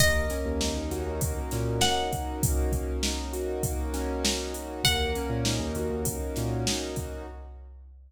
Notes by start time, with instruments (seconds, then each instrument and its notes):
0.00 synth bass 2 D#2, acoustic grand piano A#3, pizzicato strings D#5, kick, closed hi-hat
0.30 acoustic grand piano C#4, snare, closed hi-hat
0.45 synth bass 2 D#2
0.61 acoustic grand piano D#4, snare
0.76 synth bass 2 D#2
0.91 synth bass 2 D#2, acoustic grand piano F#4, snare, closed hi-hat
1.06 synth bass 2 D#2
1.21 acoustic grand piano A#3, kick, closed hi-hat
1.51 synth bass 2 A#2, acoustic grand piano C#4, snare, closed hi-hat
1.80 acoustic grand piano D#4, pizzicato strings F#5, snare
2.11 acoustic grand piano F#4, kick, closed hi-hat
2.43 acoustic grand piano A#3, kick, closed hi-hat
2.72 acoustic grand piano C#4, kick, closed hi-hat
3.03 acoustic grand piano D#4, snare
3.33 acoustic grand piano F#4, closed hi-hat
3.63 acoustic grand piano A#3, kick, closed hi-hat
3.94 acoustic grand piano C#4, snare, closed hi-hat
4.24 acoustic grand piano D#4, snare
4.54 acoustic grand piano F#4, closed hi-hat
4.84 synth bass 2 D#2, acoustic grand piano A#3, pizzicato strings F#5, kick, closed hi-hat
5.15 acoustic grand piano C#4, closed hi-hat
5.30 synth bass 2 A#2
5.44 acoustic grand piano D#4, snare
5.59 synth bass 2 D#2
5.75 synth bass 2 D#2, acoustic grand piano F#4, closed hi-hat
5.90 synth bass 2 D#2
6.05 acoustic grand piano A#3, kick, closed hi-hat
6.36 synth bass 2 A#2, acoustic grand piano C#4, snare, closed hi-hat
6.67 acoustic grand piano D#4, snare
6.96 acoustic grand piano F#4, kick, closed hi-hat